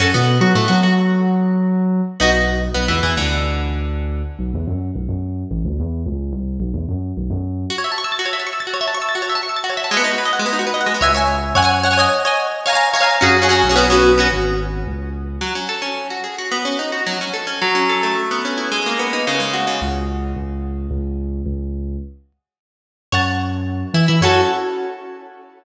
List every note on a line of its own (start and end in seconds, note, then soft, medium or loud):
0.00 0.12 F#2 loud
0.00 0.10 C#4 medium
0.00 0.10 F#4 medium
0.00 0.10 A4 loud
0.14 0.38 B2 loud
0.14 0.37 B3 medium
0.41 0.52 F#3 loud
0.41 0.53 F#4 medium
0.55 0.67 A2 medium
0.55 0.67 A3 medium
0.68 0.81 F#3 loud
0.68 0.80 F#4 medium
0.83 2.01 F#3 medium
0.83 2.00 F#4 medium
2.20 2.67 B1 loud
2.20 2.31 B3 medium
2.20 2.31 D#4 medium
2.20 2.31 F#4 loud
2.74 2.87 B1 loud
2.74 2.86 B3 medium
2.88 3.01 E2 medium
2.88 3.00 E3 medium
3.03 3.15 E2 medium
3.03 3.15 E3 medium
3.17 4.22 D2 medium
3.17 4.23 D3 medium
4.39 4.51 B1 loud
4.54 4.66 E2 loud
4.67 4.91 F#2 medium
4.95 5.07 B1 medium
5.08 5.44 F#2 medium
5.51 5.62 A1 loud
5.65 5.77 D2 medium
5.79 6.02 E2 loud
6.06 6.31 C#2 loud
6.32 6.57 C2 medium
6.60 6.72 B1 loud
6.74 6.86 E2 medium
6.88 7.12 F#2 medium
7.17 7.29 B1 loud
7.30 7.65 F#2 medium
7.70 7.76 F#4 loud
7.78 7.84 C#5 medium
7.84 7.90 E5 medium
7.92 7.98 A5 medium
7.98 8.04 C#6 medium
8.04 8.10 E6 medium
8.12 8.18 A6 medium
8.19 8.25 F#4 medium
8.25 8.32 C#5 medium
8.33 8.39 E5 medium
8.40 8.46 A5 medium
8.47 8.53 C#6 medium
8.53 8.59 E6 medium
8.60 8.66 A6 medium
8.67 8.73 F#4 medium
8.74 8.80 C#5 medium
8.81 8.87 E5 medium
8.88 8.94 A5 medium
8.94 9.01 C#6 medium
9.02 9.08 E6 medium
9.09 9.15 A6 loud
9.15 9.21 F#4 medium
9.22 9.28 C#5 medium
9.30 9.36 E5 medium
9.35 9.41 A5 medium
9.43 9.49 C#6 medium
9.49 9.55 E6 medium
9.56 9.63 A6 medium
9.64 9.70 F#4 medium
9.70 9.76 C#5 medium
9.77 9.83 E5 medium
9.84 9.90 A5 medium
9.91 9.97 G#3 loud
9.97 10.03 B3 loud
10.04 10.10 D#4 medium
10.11 10.18 F#4 medium
10.18 10.24 B4 medium
10.25 10.32 D#5 medium
10.33 10.39 F#5 medium
10.39 10.46 G#3 medium
10.46 10.52 B3 medium
10.53 10.59 D#4 medium
10.59 10.65 F#4 medium
10.67 10.73 B4 medium
10.74 10.80 D#5 medium
10.81 10.87 F#5 medium
10.86 10.92 G#3 medium
10.94 11.00 B3 medium
11.01 11.52 C#2 medium
11.01 11.12 C#5 medium
11.01 11.12 E5 loud
11.01 11.12 G#5 loud
11.15 11.37 C#5 medium
11.15 11.37 E5 medium
11.15 11.37 G#5 medium
11.55 12.06 F#2 medium
11.55 11.61 C#5 loud
11.55 11.61 F#5 loud
11.55 11.61 G#5 loud
11.62 11.79 C#5 loud
11.62 11.79 F#5 medium
11.62 11.79 G#5 medium
11.83 11.89 C#5 medium
11.83 11.89 F#5 medium
11.83 11.89 G#5 medium
11.91 11.97 C#5 medium
11.91 11.97 F#5 medium
11.91 11.97 G#5 medium
11.98 12.22 C#5 loud
11.98 12.22 D#5 loud
11.98 12.22 G#5 loud
12.25 12.47 C#5 medium
12.25 12.47 D#5 medium
12.25 12.47 G#5 loud
12.66 12.71 C#5 loud
12.66 12.71 F5 loud
12.66 12.71 G#5 loud
12.66 12.72 A#5 loud
12.73 12.89 C#5 medium
12.73 12.89 F5 medium
12.73 12.89 G#5 loud
12.73 12.89 A#5 medium
12.94 12.99 C#5 loud
12.94 12.99 F5 medium
12.94 12.99 G#5 medium
12.94 13.00 A#5 medium
13.00 13.17 C#5 medium
13.00 13.17 F5 medium
13.00 13.17 G#5 medium
13.00 13.17 A#5 medium
13.21 13.61 F#2 medium
13.21 13.37 C#4 loud
13.21 13.37 F#4 loud
13.21 13.37 G#4 loud
13.42 13.47 C#4 medium
13.42 13.47 F#4 medium
13.42 13.47 G#4 medium
13.49 13.65 C#4 medium
13.49 13.65 F#4 medium
13.49 13.65 G#4 loud
13.63 14.27 B1 medium
13.69 13.75 C#4 medium
13.69 13.75 F#4 loud
13.69 13.75 G#4 medium
13.76 13.87 B3 loud
13.76 13.87 C#4 loud
13.76 13.87 F#4 loud
13.90 14.12 B3 medium
13.90 14.12 C#4 medium
13.90 14.12 F#4 loud
14.18 14.29 B3 medium
14.18 14.29 C#4 medium
14.18 14.29 F#4 medium
14.31 14.82 G#1 medium
14.87 15.37 C#2 medium
15.41 15.53 F#3 medium
15.55 15.68 C#4 medium
15.69 15.81 A4 medium
15.82 16.08 C#4 medium
16.10 16.23 F#4 medium
16.24 16.36 G#4 medium
16.38 16.51 F#4 medium
16.52 16.64 B3 medium
16.65 16.77 C#4 medium
16.79 16.91 D#4 medium
16.92 17.05 F#4 medium
17.06 17.19 F#3 medium
17.21 17.33 C#4 medium
17.34 17.46 A4 medium
17.47 17.59 C#4 medium
17.62 18.14 F#3 medium
17.75 18.14 C#4 medium
17.89 18.16 A4 medium
18.03 18.69 A3 medium
18.31 18.70 B3 medium
18.45 18.71 C#4 medium
18.58 18.71 E4 medium
18.72 19.24 G#3 medium
18.86 19.25 A#3 medium
18.99 19.25 B3 medium
19.13 19.26 D#4 medium
19.27 19.67 C#3 medium
19.40 19.79 G#3 medium
19.53 19.80 F#4 medium
19.67 19.80 C#3 medium
19.82 20.32 C#2 loud
20.36 20.87 C#2 medium
20.91 21.41 C#2 loud
21.46 21.96 C#2 medium
23.12 23.83 F#2 loud
23.12 23.22 C#5 loud
23.12 23.22 F#5 medium
23.12 23.22 A5 medium
23.94 24.05 E3 medium
23.94 24.06 E4 medium
24.08 24.21 E3 medium
24.08 24.20 E4 medium
24.21 24.40 F#2 loud
24.21 24.41 C#4 loud
24.21 24.41 F#4 medium
24.21 24.41 A4 medium